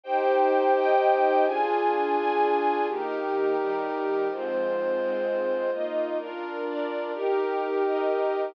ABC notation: X:1
M:3/4
L:1/8
Q:1/4=127
K:Eb
V:1 name="String Ensemble 1"
[Ecg]3 [Eeg]3 | [DFa]3 [DAa]3 | [E,B,G]3 [E,G,G]3 | [A,,F,C]3 [A,,A,C]3 |
[B,Fe]2 [DFB]2 [DBd]2 | [EGB]3 [EBe]3 |]
V:2 name="Pad 2 (warm)"
[EGc]6 | [DFA]6 | [EGB]6 | [A,Fc]6 |
[B,EF]2 [DFB]4 | [EGB]6 |]